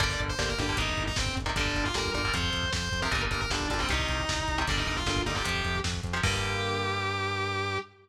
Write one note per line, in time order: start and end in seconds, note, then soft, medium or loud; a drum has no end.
0.00 0.17 G1 medium
0.00 0.31 D3 loud
0.00 0.31 G3 loud
0.00 0.31 A#3 loud
0.00 0.09 D5 loud
0.00 kick loud
0.00 closed hi-hat loud
0.10 0.19 D5 loud
0.10 kick medium
0.19 0.36 G1 medium
0.19 kick medium
0.19 closed hi-hat medium
0.28 0.48 C5 loud
0.28 kick medium
0.39 0.56 G1 medium
0.39 0.54 D3 medium
0.39 0.54 G3 medium
0.39 0.54 A#3 medium
0.39 kick medium
0.39 snare loud
0.48 0.58 A#4 medium
0.48 kick medium
0.58 0.75 G1 medium
0.58 0.67 D3 medium
0.58 0.67 G3 medium
0.58 0.67 A#3 medium
0.58 0.77 G4 loud
0.58 kick medium
0.58 closed hi-hat medium
0.69 0.77 D3 medium
0.69 0.77 G3 medium
0.69 0.77 A#3 medium
0.69 kick medium
0.77 0.95 G1 medium
0.77 1.09 C3 loud
0.77 1.09 D#3 loud
0.77 1.09 G3 loud
0.77 1.03 D#4 medium
0.77 kick loud
0.77 closed hi-hat loud
0.89 kick medium
0.97 1.14 G1 medium
0.97 kick medium
0.97 closed hi-hat medium
1.07 1.16 D#4 loud
1.07 kick medium
1.16 1.33 G1 medium
1.16 1.35 C4 loud
1.16 kick loud
1.16 snare loud
1.26 kick medium
1.36 1.53 G1 medium
1.36 kick medium
1.36 closed hi-hat medium
1.46 1.54 C3 medium
1.46 1.54 D#3 medium
1.46 1.54 G3 medium
1.46 kick medium
1.56 1.72 G1 medium
1.56 1.88 A#2 loud
1.56 1.88 D3 loud
1.56 1.88 G3 loud
1.56 1.84 D4 loud
1.56 kick medium
1.56 closed hi-hat loud
1.66 kick medium
1.75 1.92 G1 medium
1.75 kick medium
1.75 closed hi-hat medium
1.85 1.94 F4 medium
1.85 kick medium
1.94 2.11 G1 medium
1.94 2.11 A#2 medium
1.94 2.11 D3 medium
1.94 2.11 G3 loud
1.94 2.11 A#4 loud
1.94 kick medium
1.94 snare loud
2.05 kick medium
2.14 2.31 G1 medium
2.14 2.22 A#2 medium
2.14 2.22 D3 medium
2.14 2.22 G3 medium
2.14 2.33 A#4 medium
2.14 kick medium
2.14 closed hi-hat medium
2.24 2.33 A#2 medium
2.24 2.33 D3 medium
2.24 2.33 G3 medium
2.24 kick medium
2.34 2.50 F2 loud
2.34 2.65 C3 loud
2.34 2.65 F3 loud
2.34 2.71 C5 medium
2.34 kick medium
2.34 closed hi-hat loud
2.43 kick medium
2.53 2.70 F2 medium
2.53 kick medium
2.53 closed hi-hat medium
2.63 kick medium
2.73 2.89 F2 medium
2.73 3.00 C5 medium
2.73 kick medium
2.73 snare loud
2.82 kick medium
2.91 3.09 F2 medium
2.91 kick medium
2.91 closed hi-hat medium
3.02 3.10 C3 medium
3.02 3.10 F3 medium
3.02 3.11 A#4 medium
3.02 kick medium
3.11 3.28 G1 loud
3.11 3.43 A#2 loud
3.11 3.43 D3 loud
3.11 3.43 G3 medium
3.11 3.21 A#4 loud
3.11 kick loud
3.11 closed hi-hat medium
3.22 kick medium
3.31 3.48 G1 medium
3.31 3.40 A#4 medium
3.31 kick medium
3.31 closed hi-hat medium
3.41 3.50 A#4 medium
3.41 kick medium
3.50 3.67 G1 medium
3.50 3.67 A#2 medium
3.50 3.67 D3 medium
3.50 3.67 G3 medium
3.50 3.67 D4 loud
3.50 kick medium
3.50 snare loud
3.60 kick medium
3.70 3.87 G1 medium
3.70 3.78 A#2 medium
3.70 3.78 D3 medium
3.70 3.78 G3 loud
3.70 3.79 D4 medium
3.70 kick medium
3.70 closed hi-hat medium
3.79 3.87 A#2 loud
3.79 3.87 D3 medium
3.79 3.87 G3 medium
3.79 3.89 C4 loud
3.79 kick medium
3.89 4.06 C2 medium
3.89 4.21 C3 loud
3.89 4.21 D#3 loud
3.89 4.21 G3 loud
3.89 4.58 D#4 loud
3.89 kick medium
3.89 closed hi-hat loud
3.99 kick medium
4.08 4.26 C2 medium
4.08 kick medium
4.08 closed hi-hat medium
4.20 kick medium
4.28 4.45 C2 medium
4.28 kick medium
4.28 snare loud
4.38 kick medium
4.48 4.65 C2 medium
4.48 kick medium
4.48 closed hi-hat medium
4.58 4.66 C3 medium
4.58 4.66 D#3 medium
4.58 4.66 G3 medium
4.58 kick medium
4.67 4.84 G1 loud
4.67 5.00 A#2 loud
4.67 5.00 D3 loud
4.67 5.00 G3 loud
4.67 4.77 D4 loud
4.67 kick loud
4.67 closed hi-hat loud
4.77 4.87 D#4 medium
4.77 kick medium
4.86 5.04 G1 medium
4.86 4.96 D#4 medium
4.86 kick medium
4.86 closed hi-hat medium
4.97 5.21 F4 medium
4.97 kick medium
5.06 5.23 G1 medium
5.06 5.22 A#2 loud
5.06 5.22 D3 medium
5.06 5.22 G3 medium
5.06 kick medium
5.06 snare loud
5.16 kick medium
5.26 5.42 G1 medium
5.26 5.34 A#2 medium
5.26 5.34 D3 medium
5.26 5.34 G3 medium
5.26 5.35 D#4 medium
5.26 kick medium
5.26 closed hi-hat medium
5.35 5.43 A#2 loud
5.35 5.43 D3 medium
5.35 5.43 G3 medium
5.35 5.79 G4 medium
5.35 kick medium
5.44 5.62 F2 medium
5.44 5.76 C3 loud
5.44 5.76 F3 loud
5.44 kick medium
5.44 closed hi-hat loud
5.55 kick medium
5.64 5.81 F2 medium
5.64 kick medium
5.64 closed hi-hat medium
5.75 kick medium
5.84 6.01 F2 medium
5.84 kick medium
5.84 snare loud
5.94 kick medium
6.03 6.21 F2 medium
6.03 kick medium
6.03 closed hi-hat medium
6.13 6.21 C3 medium
6.13 6.21 F3 medium
6.23 7.78 G2 loud
6.23 7.78 D3 loud
6.23 7.78 G3 loud
6.23 7.78 A#3 loud
6.23 7.78 G4 loud
6.23 kick loud
6.23 crash loud
6.33 kick medium